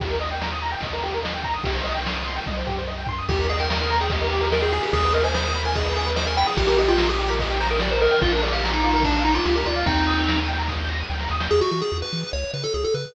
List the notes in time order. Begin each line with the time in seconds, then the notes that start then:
0.00 D#2 G4, kick, ride
0.10 A#4
0.20 D#5, ride
0.31 G5
0.41 A#5, snare
0.51 D#6
0.62 A#5, ride
0.72 G5
0.80 D#2 D#5, kick, ride
0.93 A#4
1.03 G4, ride
1.14 A#4
1.24 D#5, snare
1.34 G5
1.43 A#5, kick, ride
1.54 D#6
1.64 C2 G4, kick, ride
1.74 C5
1.84 D#5, ride
1.95 G5
2.05 C6, snare
2.16 D#6
2.26 C6, ride
2.36 G5
2.46 C2 D#5, kick, high tom
2.57 C5
2.67 G4, floor tom
2.78 C5
2.87 D#5
2.98 G5
3.06 C6, floor tom
3.18 D#6
3.29 D#2 G4, kick, crash
3.38 A#4, ride
3.49 G#4 D#5, ride
3.58 A#4 G5, ride
3.70 A#4 A#5, snare
3.80 A#4 D#6, ride
3.90 A#5, ride
4.00 G#4 G5, ride
4.10 G4 D#5, kick, ride
4.21 A#4, ride
4.30 G4, ride
4.41 A#4, ride
4.52 A#4 D#5, snare
4.62 G#4 G5, ride
4.72 G#4, ride
4.83 G4, ride
4.93 D#2 G#4, kick, ride
5.03 B4, ride
5.13 A#4 D#5, ride
5.23 C5 G#5, ride
5.34 C5 B5, snare
5.44 C5 D#6, ride
5.55 B5, ride
5.65 A#4 G#5, ride
5.75 G#4 D#5, kick, ride
5.85 B4, ride
5.94 G#4, ride
6.06 B4, ride
6.16 C5 D#5, snare
6.27 A#4 G#5, ride
6.37 G5 B5, ride
6.46 G#4 D#6, ride
6.57 A#1 G4, kick, ride
6.67 G4 A#4, ride
6.78 G4 D#5, ride
6.88 F4 G5, ride
6.98 A#5, snare
7.08 G4 D#6, ride
7.19 G4, ride
7.28 A#4, ride
7.39 G4 D#5, kick, ride
7.50 G5, ride
7.60 C5 A#5, ride
7.70 A#4 D#6, ride
7.80 G4 D5, snare
7.91 A#4 C5, ride
8.01 A#4 D#5, ride
8.11 G5, ride
8.21 A#1 F4, kick, ride
8.32 D4 A#4, ride
8.42 G#4 D5, ride
8.52 G4 F5, ride
8.63 A#5, snare
8.71 D#4 D6, ride
8.83 F4, ride
8.93 A#4, ride
9.03 D4 D5, kick, ride
9.14 F5, ride
9.24 D#4 A#5, ride
9.34 F4 D6, ride
9.45 C#2 F4 G4, snare
9.54 G4 A#4, ride
9.65 D2 F4 D5, ride
9.76 F5, ride
9.86 D#2 C4 D#4 G5, kick, ride
9.96 A#5, ride
10.07 D#6, ride
10.17 G6, ride
10.28 A#6, snare
10.38 D#7, ride
10.48 G5, ride
10.57 A#5, ride
10.68 D#6, kick, snare
10.79 G6
10.89 A#6, snare
11.00 D#7
11.09 D2 G5, snare
11.20 A#5, snare
11.29 D#2 D#6, snare
11.40 G6, snare
11.51 E2 G#4
11.61 F#4
11.71 E3 F#4
11.82 G#4
11.92 E2
12.02 B4
12.13 E3
12.33 C#2 C#5
12.54 C#3 B4
12.64 A4
12.74 C#2 G#4
12.84 A4
12.94 C#3 B4